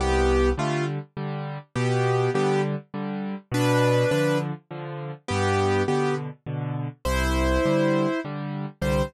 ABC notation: X:1
M:3/4
L:1/8
Q:1/4=102
K:C
V:1 name="Acoustic Grand Piano"
[B,G]2 [A,F] z3 | [B,G]2 [B,G] z3 | [DB]2 [DB] z3 | [B,G]2 [B,G] z3 |
[Ec]4 z2 | c2 z4 |]
V:2 name="Acoustic Grand Piano" clef=bass
C,,2 [D,G,]2 [D,G,]2 | B,,2 [D,G,]2 [D,G,]2 | B,,2 [D,F,]2 [D,F,]2 | G,,2 [B,,D,]2 [B,,D,]2 |
C,,2 [D,G,]2 [D,G,]2 | [C,,D,G,]2 z4 |]